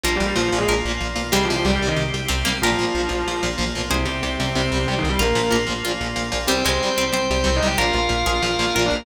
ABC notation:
X:1
M:4/4
L:1/8
Q:1/4=186
K:Cm
V:1 name="Distortion Guitar"
(3[F,F] [G,G] [G,G] (3[F,F] [F,F] [A,A] z4 | (3[G,G] [F,F] [F,F] (3[G,G] [G,G] [E,E] z4 | [F,F]5 z3 | [C,C] [C,C]3 [C,C]2 (3[C,C] [E,E] [G,G] |
[B,B]2 z6 | [Cc] [Cc]3 [Cc]2 (3[Cc] [Ee] [Gg] | [Ff] [Ff]3 [Ff]2 (3[Ff] [Dd] [B,B] |]
V:2 name="Harpsichord"
[G,B,]4 B2 z2 | [A,C]4 z2 C B, | [GB]8 | [Ac]8 |
F z B2 F z3 | G, A,2 C c z3 | [GB]3 A3 B2 |]
V:3 name="Overdriven Guitar" clef=bass
[B,,F,] [B,,F,] [B,,F,] [B,,F,] [B,,F,] [B,,F,] [B,,F,] [B,,F,] | [C,G,] [C,G,] [C,G,] [C,G,] [C,G,] [C,G,] [C,G,] [C,G,] | [B,,F,] [B,,F,] [B,,F,] [B,,F,] [B,,F,] [B,,F,] [B,,F,] [B,,F,] | [C,G,] [C,G,] [C,G,] [C,G,] [C,G,] [C,G,] [C,G,] [C,G,] |
[B,,F,] [B,,F,] [B,,F,] [B,,F,] [B,,F,] [B,,F,] [B,,F,] [B,,F,] | [C,G,] [C,G,] [C,G,] [C,G,] [C,G,] [C,G,] [C,G,] [C,G,] | [B,,F,] [B,,F,] [B,,F,] [B,,F,] [B,,F,] [B,,F,] [B,,F,] [B,,F,] |]
V:4 name="Synth Bass 1" clef=bass
B,,, B,,, B,,, B,,, B,,, B,,, B,,, =B,,, | C,, C,, C,, C,, C,, C,, C,, C,, | B,,, B,,, B,,, B,,, B,,, B,,, B,,, =B,,, | C,, C,, C,, C,, C,, C,, C,, C,, |
B,,, B,,, B,,, B,,, B,,, B,,, B,,, B,,, | C,, C,, C,, C,, C,, C,, C,, C,, | B,,, B,,, B,,, B,,, B,,, B,,, B,,, B,,, |]
V:5 name="Drawbar Organ"
[B,F]8 | [CG]8 | [B,F]8 | [CG]8 |
[B,F]8 | [cg]8 | [Bf]8 |]